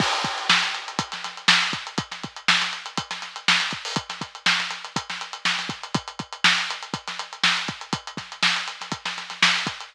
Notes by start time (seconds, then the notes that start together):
0.00 kick, crash
0.13 closed hi-hat
0.24 kick, closed hi-hat
0.38 closed hi-hat
0.49 snare
0.63 snare, closed hi-hat
0.75 closed hi-hat
0.88 closed hi-hat
0.99 kick, closed hi-hat
1.12 snare, closed hi-hat
1.24 snare, closed hi-hat
1.37 closed hi-hat
1.48 snare
1.62 closed hi-hat
1.73 kick, closed hi-hat
1.87 closed hi-hat
1.98 kick, closed hi-hat
2.11 snare, closed hi-hat
2.23 kick, closed hi-hat
2.36 closed hi-hat
2.48 snare
2.62 snare, closed hi-hat
2.73 closed hi-hat
2.86 closed hi-hat
2.98 kick, closed hi-hat
3.11 snare, closed hi-hat
3.22 snare, closed hi-hat
3.36 closed hi-hat
3.48 snare
3.60 snare, closed hi-hat
3.71 kick, closed hi-hat
3.85 open hi-hat
3.96 kick, closed hi-hat
4.10 snare, closed hi-hat
4.21 kick, closed hi-hat
4.35 closed hi-hat
4.46 snare
4.59 snare, closed hi-hat
4.71 snare, closed hi-hat
4.85 closed hi-hat
4.96 kick, closed hi-hat
5.10 snare, closed hi-hat
5.21 closed hi-hat
5.33 closed hi-hat
5.45 snare
5.59 snare, closed hi-hat
5.69 kick, closed hi-hat
5.83 closed hi-hat
5.95 kick, closed hi-hat
6.08 closed hi-hat
6.19 kick, closed hi-hat
6.33 closed hi-hat
6.44 snare
6.58 closed hi-hat
6.70 closed hi-hat
6.83 closed hi-hat
6.94 kick, closed hi-hat
7.08 snare, closed hi-hat
7.19 closed hi-hat
7.33 closed hi-hat
7.43 snare
7.57 closed hi-hat
7.68 kick, closed hi-hat
7.81 closed hi-hat
7.93 kick, closed hi-hat
8.07 closed hi-hat
8.17 kick, snare, closed hi-hat
8.32 closed hi-hat
8.43 snare
8.56 closed hi-hat
8.68 closed hi-hat
8.81 snare, closed hi-hat
8.92 kick, closed hi-hat
9.05 snare, closed hi-hat
9.17 snare, closed hi-hat
9.30 snare, closed hi-hat
9.42 snare
9.56 closed hi-hat
9.67 kick, closed hi-hat
9.80 closed hi-hat